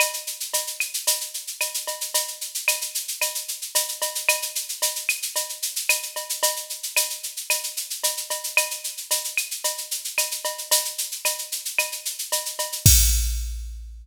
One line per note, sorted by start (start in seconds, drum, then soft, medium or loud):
0.00 cowbell medium
0.00 claves medium
0.00 shaker medium
0.14 shaker medium
0.27 shaker medium
0.40 shaker medium
0.54 cowbell medium
0.54 shaker medium
0.67 shaker medium
0.80 claves medium
0.80 shaker medium
0.94 shaker medium
1.07 cowbell medium
1.07 shaker medium
1.21 shaker medium
1.34 shaker medium
1.47 shaker medium
1.61 cowbell medium
1.61 claves medium
1.61 shaker medium
1.74 shaker medium
1.87 cowbell medium
1.87 shaker medium
2.01 shaker medium
2.14 cowbell medium
2.14 shaker medium
2.28 shaker medium
2.41 shaker medium
2.55 shaker medium
2.68 cowbell medium
2.68 claves medium
2.68 shaker medium
2.81 shaker medium
2.95 shaker medium
3.08 shaker medium
3.21 cowbell medium
3.21 claves medium
3.21 shaker medium
3.35 shaker medium
3.48 shaker medium
3.62 shaker medium
3.75 cowbell medium
3.75 shaker medium
3.88 shaker medium
4.02 cowbell medium
4.02 shaker medium
4.15 shaker medium
4.29 cowbell medium
4.29 claves medium
4.29 shaker medium
4.42 shaker medium
4.55 shaker medium
4.69 shaker medium
4.82 cowbell medium
4.82 shaker medium
4.96 shaker medium
5.09 claves medium
5.09 shaker medium
5.22 shaker medium
5.36 cowbell medium
5.36 shaker medium
5.49 shaker medium
5.62 shaker medium
5.76 shaker medium
5.89 cowbell medium
5.89 claves medium
5.89 shaker medium
6.03 shaker medium
6.16 cowbell medium
6.16 shaker medium
6.29 shaker medium
6.43 cowbell medium
6.43 shaker medium
6.56 shaker medium
6.70 shaker medium
6.83 shaker medium
6.97 cowbell medium
6.97 claves medium
6.97 shaker medium
7.10 shaker medium
7.23 shaker medium
7.37 shaker medium
7.50 cowbell medium
7.50 claves medium
7.50 shaker medium
7.63 shaker medium
7.77 shaker medium
7.90 shaker medium
8.04 cowbell medium
8.04 shaker medium
8.17 shaker medium
8.30 cowbell medium
8.30 shaker medium
8.44 shaker medium
8.57 cowbell medium
8.57 claves medium
8.57 shaker medium
8.71 shaker medium
8.84 shaker medium
8.97 shaker medium
9.11 cowbell medium
9.11 shaker medium
9.24 shaker medium
9.37 claves medium
9.37 shaker medium
9.51 shaker medium
9.64 cowbell medium
9.64 shaker medium
9.78 shaker medium
9.91 shaker medium
10.04 shaker medium
10.18 cowbell medium
10.18 claves medium
10.18 shaker medium
10.31 shaker medium
10.45 cowbell medium
10.45 shaker medium
10.58 shaker medium
10.71 cowbell medium
10.71 shaker loud
10.85 shaker medium
10.98 shaker medium
11.11 shaker medium
11.25 cowbell medium
11.25 claves medium
11.25 shaker medium
11.38 shaker medium
11.52 shaker medium
11.65 shaker medium
11.78 cowbell medium
11.78 claves medium
11.78 shaker medium
11.92 shaker medium
12.05 shaker medium
12.19 shaker medium
12.32 cowbell medium
12.32 shaker medium
12.46 shaker medium
12.59 cowbell medium
12.59 shaker medium
12.72 shaker medium
12.86 kick loud
12.86 crash loud